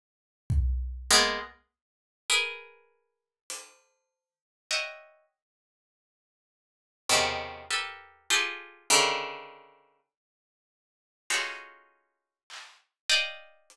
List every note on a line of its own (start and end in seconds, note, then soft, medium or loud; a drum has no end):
0.50 kick loud
1.10 1.38 G#3 loud
1.10 1.38 A#3 loud
1.10 1.38 B3 loud
2.30 3.38 G#4 medium
2.30 3.38 A#4 medium
2.30 3.38 B4 medium
3.50 closed hi-hat loud
4.71 5.25 C#5 medium
4.71 5.25 D#5 medium
4.71 5.25 E5 medium
4.71 5.25 F#5 medium
4.71 5.25 G5 medium
7.09 7.63 B2 medium
7.09 7.63 C3 medium
7.09 7.63 C#3 medium
7.09 7.63 D#3 medium
7.09 floor tom medium
7.71 8.25 G4 medium
7.71 8.25 A4 medium
7.71 8.25 A#4 medium
7.71 8.25 B4 medium
8.30 8.84 F4 medium
8.30 8.84 G4 medium
8.30 8.84 G#4 medium
8.30 8.84 A4 medium
8.90 9.98 C#3 medium
8.90 9.98 D3 medium
8.90 9.98 D#3 medium
11.30 12.38 C#4 medium
11.30 12.38 D#4 medium
11.30 12.38 F4 medium
11.30 12.38 F#4 medium
11.30 12.38 G#4 medium
11.30 12.38 A4 medium
11.30 clap loud
12.50 clap medium
13.10 13.76 D5 medium
13.10 13.76 D#5 medium
13.10 13.76 F5 medium
13.10 13.76 G5 medium
13.70 closed hi-hat medium